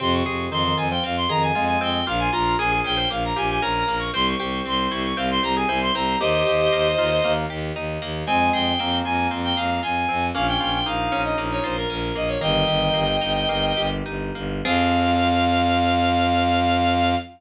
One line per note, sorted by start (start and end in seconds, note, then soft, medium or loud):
0.00 0.22 F2 loud
0.00 0.24 C3 loud
0.00 0.51 C4 medium
0.00 0.12 C6 medium
0.13 0.45 C#6 medium
0.26 0.48 F2 medium
0.26 0.50 C3 medium
0.26 1.29 G#4 medium
0.51 0.73 F2 medium
0.51 0.64 D#3 medium
0.51 1.03 C4 medium
0.51 0.76 C6 medium
0.65 0.88 D#3 loud
0.77 0.99 F2 medium
0.77 1.55 F4 medium
0.77 0.89 G#5 medium
0.91 1.04 F3 loud
0.91 1.03 G5 medium
1.04 1.26 F2 medium
1.04 1.80 C4 medium
1.04 1.16 F5 medium
1.17 1.29 C6 medium
1.29 1.52 F2 medium
1.29 1.52 D#3 loud
1.29 2.03 G#4 medium
1.29 1.42 A#5 medium
1.42 1.64 G#5 medium
1.55 1.77 F2 medium
1.55 2.01 G#3 loud
1.55 2.04 F4 medium
1.67 1.79 G#5 medium
1.81 2.03 F2 medium
1.81 2.06 C4 loud
1.81 2.05 G5 medium
2.07 2.29 A#1 medium
2.07 2.58 A#3 medium
2.07 2.30 F4 loud
2.07 2.20 F5 medium
2.19 2.31 G#5 medium
2.32 2.56 A#1 medium
2.32 3.36 F4 medium
2.32 2.57 F4 loud
2.32 2.56 A#5 medium
2.59 2.81 A#1 medium
2.59 3.10 A#3 medium
2.59 2.71 G#4 loud
2.59 2.79 G#5 medium
2.72 2.97 G#4 medium
2.84 3.06 A#1 medium
2.84 3.62 C#4 medium
2.84 3.08 G5 medium
2.97 3.09 C5 loud
3.10 3.33 A#1 medium
3.10 3.87 A#3 medium
3.10 3.23 F5 medium
3.25 3.37 A#5 medium
3.36 3.59 A#1 medium
3.36 4.10 F4 medium
3.36 3.60 G4 medium
3.36 3.49 G#5 medium
3.51 3.63 G#5 medium
3.61 3.83 A#1 medium
3.61 4.11 C#4 medium
3.61 4.11 A#4 loud
3.61 3.95 A#5 medium
3.88 4.10 A#1 medium
3.88 4.12 A#3 medium
3.99 4.12 C#6 medium
4.13 4.35 C2 medium
4.13 4.65 C4 medium
4.13 4.35 C5 loud
4.13 4.26 C6 medium
4.26 4.62 C#6 medium
4.39 4.61 C2 medium
4.39 5.43 G4 medium
4.39 5.06 C5 medium
4.66 4.87 C2 medium
4.66 5.16 C4 medium
4.66 4.88 C6 medium
4.90 5.13 C2 medium
4.90 5.68 E4 medium
4.90 5.02 C#6 medium
5.05 5.17 C#6 medium
5.17 5.39 C2 medium
5.17 5.94 C4 medium
5.17 5.42 C5 medium
5.17 5.29 F5 medium
5.30 5.43 C6 medium
5.43 5.65 C2 medium
5.43 6.17 G4 medium
5.43 5.55 C5 medium
5.43 5.56 A#5 medium
5.56 5.69 G#4 medium
5.56 5.79 G#5 medium
5.69 5.91 C2 medium
5.69 6.18 E4 medium
5.69 5.92 C5 loud
5.81 5.94 C6 medium
5.94 6.16 C2 medium
5.94 6.19 C4 medium
5.94 6.16 C5 loud
5.94 6.19 A#5 medium
6.20 6.43 D#2 medium
6.20 6.72 A#3 medium
6.20 6.88 G4 medium
6.20 7.32 C5 medium
6.20 7.32 D#5 loud
6.46 6.68 D#2 medium
6.46 7.49 G4 medium
6.73 6.95 D#2 medium
6.73 7.24 A#3 medium
6.98 7.20 D#2 medium
6.98 7.75 D#4 medium
6.98 7.11 F4 medium
7.24 7.46 D#2 medium
7.24 8.01 A#3 medium
7.24 7.46 A#3 loud
7.50 7.72 D#2 medium
7.50 8.24 G4 medium
7.76 7.98 D#2 medium
7.76 8.25 D#4 medium
8.02 8.24 D#2 medium
8.02 8.27 A#3 medium
8.27 8.50 F2 medium
8.27 8.72 G#3 loud
8.27 8.79 C4 medium
8.27 8.49 G#5 medium
8.53 8.75 F2 medium
8.53 9.57 G#4 medium
8.53 8.97 G5 medium
8.79 9.02 F2 medium
8.79 9.82 A#3 medium
8.79 9.30 C4 medium
9.05 9.28 F2 medium
9.05 9.82 F4 medium
9.05 9.27 G#5 medium
9.31 9.53 F2 medium
9.31 10.08 C4 medium
9.44 9.56 G5 medium
9.57 9.79 F2 medium
9.57 10.31 G#4 medium
9.57 9.81 F5 medium
9.83 10.05 F2 medium
9.83 10.32 F4 medium
9.83 10.26 G#5 medium
10.09 10.31 F2 medium
10.09 10.33 C4 medium
10.34 10.57 A#1 medium
10.34 10.86 A#3 medium
10.34 10.79 C#4 loud
10.34 10.46 F5 medium
10.48 10.60 G5 medium
10.60 10.82 A#1 medium
10.60 11.63 F4 medium
10.60 10.72 G5 medium
10.73 10.85 G5 medium
10.86 11.08 A#1 medium
10.86 11.37 A#3 medium
10.86 11.76 D#4 medium
10.86 11.22 F5 medium
11.12 11.34 A#1 medium
11.12 11.89 C#4 medium
11.24 11.37 D#5 medium
11.37 11.59 A#1 medium
11.37 12.15 A#3 medium
11.51 11.63 C#5 medium
11.64 11.86 A#1 medium
11.64 12.38 F4 medium
11.64 11.76 C5 medium
11.77 11.90 A#4 medium
11.90 12.12 A#1 medium
11.90 12.39 C#4 medium
11.90 12.15 A#4 medium
12.15 12.37 A#1 medium
12.15 12.40 A#3 medium
12.15 12.28 D#5 medium
12.28 12.40 C#5 medium
12.41 12.64 G1 medium
12.41 13.04 D#3 loud
12.41 12.93 A#3 medium
12.41 13.87 D#5 medium
12.41 13.87 G5 medium
12.67 12.90 G1 medium
12.67 13.76 G4 medium
12.94 13.17 G1 medium
12.94 13.48 A#3 medium
13.21 13.45 G1 medium
13.21 14.05 D#4 medium
13.48 13.72 G1 medium
13.48 14.35 A#3 medium
13.77 14.02 G1 medium
13.77 14.60 G4 medium
14.06 14.31 G1 medium
14.06 14.62 D#4 medium
14.35 14.61 G1 medium
14.35 14.63 A#3 medium
14.65 17.15 F2 medium
14.65 17.15 F3 loud
14.65 17.15 C4 loud
14.65 17.15 F4 loud
14.65 17.15 G#4 loud
14.65 17.16 F5 loud